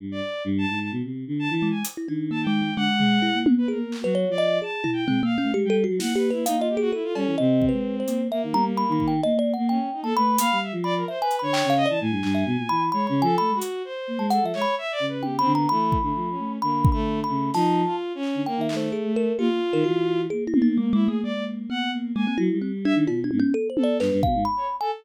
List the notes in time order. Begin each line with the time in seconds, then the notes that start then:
0.00 G2
0.12 D5
0.45 G2
0.58 A5
0.70 G#2
0.81 A5
0.92 B2
1.04 C3
1.27 D3
1.39 A5
1.50 E3 A5
1.62 G#3
1.70 G#5
1.85 closed hi-hat
1.97 E4
2.08 D#3 D4
2.31 A#3 A5
2.43 G5
2.47 G#3
2.62 G#3
2.76 D3 G#3 F#5
2.98 G#3, floor tom
3.22 E4
3.34 A#3
3.46 C4, high tom
3.58 B4
3.68 A#3 G#4 A#4
3.92 clap
4.01 F#3 F#4 B4
4.15 C#5
4.28 F3 D5
4.38 D#5
4.62 G#4 A5
4.84 E4, floor tom
4.93 G5
5.07 G#3 C4, floor tom
5.23 A#3 F5
5.38 C#4
5.42 A3
5.54 G#3 G4
5.65 G3 G5
5.70 A4
5.84 F#4
5.89 F#3
5.99 A#3 E4 F#5, snare
6.16 G4 B4
6.30 E4 B4
6.35 A#3
6.45 A#3 D#4 F5, closed hi-hat
6.57 F4 D#5
6.69 G4
6.77 F#4 G#4
6.92 E4 A4
7.04 F4
7.15 G3 C#4, cowbell
7.26 E3
7.38 C3 C4 D#5
7.62 kick
7.69 G#3 B4
8.00 C5
8.07 A#3, closed hi-hat
8.30 A#3 E5
8.43 D#3
8.52 G3 A#5, high tom
8.77 B5
8.89 D#3 B5
9.00 kick
9.08 G5
9.23 A#3 D#5, cowbell
9.34 A#3
9.39 D5
9.54 A#3 F#5
9.69 C#4 G5
9.93 D#4
10.03 A#3 A4 A5
10.16 A3 B4 B5
10.38 A#3 F5, closed hi-hat
10.52 G3
10.63 E5
10.72 F3
10.84 D5 B5
10.96 A#4
11.08 C5 E5
11.20 B4 G#5
11.31 closed hi-hat
11.39 D3 C#5 B5
11.53 G5, clap
11.65 C#3
11.70 F5
11.77 D#5
11.86 E3 D5 A5
12.00 A2 G#5
12.11 G2
12.23 G2, clap
12.35 E5
12.46 B2
12.57 A#2
12.69 E3 B5
12.92 G#3 C#5 B5
13.07 C#3 B5
13.22 F3 A4 G#5
13.38 A3 B5
13.49 G#3
13.55 F#4
13.62 closed hi-hat
13.85 C5
14.07 A#3
14.18 G#3 A5
14.30 A4 F#5, closed hi-hat
14.42 F3 E5
14.54 G#3 C#5, clap
14.62 B5
14.78 E5
14.92 D5
15.00 C#3
15.08 B4
15.23 G4 G5, high tom
15.38 C4 B5
15.45 D3
15.53 B3 A#5
15.69 E3 A3 B5
15.92 kick
16.01 D3 A3
16.15 F3
16.30 C#4
16.39 A3
16.62 D3 A#3 B5
16.85 kick
16.92 A3 B5
17.23 A3 B5
17.29 C#3
17.54 F3 D#4 A5, snare
17.85 F4
18.15 C#4
18.23 clap
18.35 D3
18.46 A#3 G5
18.57 D#3
18.61 E5
18.69 A3, clap
18.76 C5
18.92 G#4
19.05 A3
19.16 A#4
19.38 A#3 F4 G4
19.49 A#3
19.73 D#3 A#4
19.84 E3 F#4
20.30 A#3 G#4
20.47 E4
20.54 A#3, high tom
20.62 D#4
20.77 G#3 A#3
20.93 G#3 E4
21.00 A#3
21.07 A3 G#4
21.22 G#3 A#3 D5
21.34 A#3
21.70 B3 F#5
21.93 A#3
22.03 A#3
22.15 G#3 A#3 G#5
22.26 A#3 C4
22.38 F#3 E4
22.52 G3
22.62 C4
22.85 D4 E5
22.95 D#3
23.07 B2 F4, cowbell
23.24 D4
23.31 G#2, high tom
23.40 C#4
23.54 A4
23.70 C5
23.77 A4, high tom
23.83 D5
24.00 G2 B4, clap
24.12 G2
24.23 B2 F5, kick
24.35 G#2
24.45 B5
24.57 C#5
24.81 A4 G#5